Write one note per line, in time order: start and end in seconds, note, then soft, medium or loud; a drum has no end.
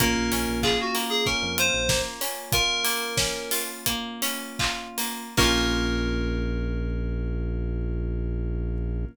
0.00 0.15 A#1 medium
0.00 0.94 A#3 loud
0.00 5.25 A#3 medium
0.00 5.25 C#4 medium
0.00 5.25 F4 medium
0.00 0.60 A#4 medium
0.00 kick loud
0.00 closed hi-hat loud
0.16 0.30 A#1 medium
0.32 0.46 A#1 medium
0.32 1.26 C#4 medium
0.32 open hi-hat medium
0.48 0.77 A#1 medium
0.63 1.57 F4 medium
0.63 0.78 G#4 medium
0.63 kick medium
0.63 clap loud
0.81 0.96 F#4 medium
0.95 1.89 A#3 medium
0.95 open hi-hat medium
1.09 1.24 G#4 medium
1.26 2.21 C#4 medium
1.26 1.56 A#4 medium
1.26 kick medium
1.42 1.71 F2 medium
1.58 2.52 F4 medium
1.58 1.99 C5 medium
1.58 closed hi-hat loud
1.74 2.02 A#1 medium
1.89 2.84 A#3 medium
1.89 kick loud
1.89 snare loud
2.21 3.17 C#4 medium
2.21 open hi-hat medium
2.52 3.51 F4 loud
2.52 3.61 A#4 loud
2.52 kick loud
2.52 closed hi-hat loud
2.85 3.86 A#3 medium
2.85 open hi-hat medium
3.17 4.22 C#4 medium
3.17 kick medium
3.17 snare loud
3.51 4.59 F4 medium
3.51 open hi-hat medium
3.86 4.97 A#3 loud
3.86 kick medium
3.86 closed hi-hat loud
4.22 5.31 C#4 medium
4.22 open hi-hat medium
4.59 5.33 F4 medium
4.59 kick medium
4.59 clap loud
4.98 5.35 A#3 medium
4.98 open hi-hat medium
5.37 9.05 A#1 loud
5.37 9.05 A#3 medium
5.37 9.05 A#3 loud
5.37 9.05 C#4 loud
5.37 9.05 C#4 medium
5.37 9.05 F4 loud
5.37 9.05 A#4 loud
5.37 kick loud
5.37 crash loud
5.43 9.05 F4 loud